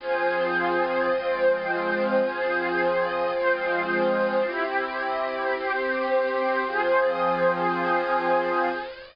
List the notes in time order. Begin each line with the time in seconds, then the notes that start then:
0.00 F3 C4 F4 G#4 C5
1.11 F3 G#3 C4 F4 G#4 C5
2.22 F3 C4 F4 G#4 C5
3.33 F3 G#3 C4 F4 G#4 C5
4.44 C4 E4 G4
5.55 C4 G4 C5
6.67 F3 C4 F4 G#4 C5